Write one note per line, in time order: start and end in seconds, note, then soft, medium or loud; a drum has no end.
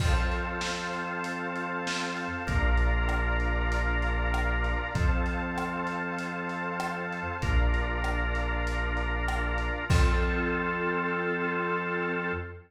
0.00 2.28 F2 medium
0.00 2.43 C4 medium
0.00 2.43 F4 medium
0.00 2.43 A4 medium
0.00 2.45 C5 medium
0.00 2.45 F5 medium
0.00 2.45 A5 medium
0.00 kick medium
0.00 crash loud
0.32 closed hi-hat medium
0.61 snare medium
0.93 closed hi-hat medium
1.24 closed hi-hat medium
1.56 closed hi-hat medium
1.87 snare medium
2.17 closed hi-hat medium
2.47 4.75 A#1 loud
2.47 4.90 D4 medium
2.47 4.90 F4 medium
2.47 4.90 A#4 medium
2.47 4.92 D5 medium
2.47 4.92 F5 medium
2.47 4.92 A#5 medium
2.47 kick medium
2.47 closed hi-hat medium
2.77 closed hi-hat medium
3.09 cross-stick medium
3.40 closed hi-hat medium
3.72 closed hi-hat medium
4.02 closed hi-hat medium
4.34 cross-stick medium
4.64 closed hi-hat medium
4.95 7.22 F2 loud
4.95 7.37 C4 medium
4.95 7.37 F4 medium
4.95 7.37 A4 medium
4.95 7.40 C5 medium
4.95 7.40 F5 medium
4.95 7.40 A5 medium
4.95 kick medium
4.95 closed hi-hat medium
5.26 closed hi-hat medium
5.58 cross-stick medium
5.87 closed hi-hat medium
6.19 closed hi-hat medium
6.49 closed hi-hat medium
6.80 cross-stick loud
7.13 closed hi-hat medium
7.42 9.70 A#1 medium
7.42 9.85 D4 medium
7.42 9.85 F4 medium
7.42 9.85 A#4 medium
7.42 9.87 D5 medium
7.42 9.87 F5 medium
7.42 9.87 A#5 medium
7.42 kick medium
7.42 closed hi-hat medium
7.74 closed hi-hat medium
8.04 cross-stick medium
8.35 closed hi-hat medium
8.67 closed hi-hat medium
8.97 closed hi-hat medium
9.28 cross-stick loud
9.58 closed hi-hat medium
9.89 12.32 F2 loud
9.89 12.32 C4 loud
9.89 12.32 F4 loud
9.89 12.32 F4 medium
9.89 12.32 A4 loud
9.89 kick loud
9.89 crash loud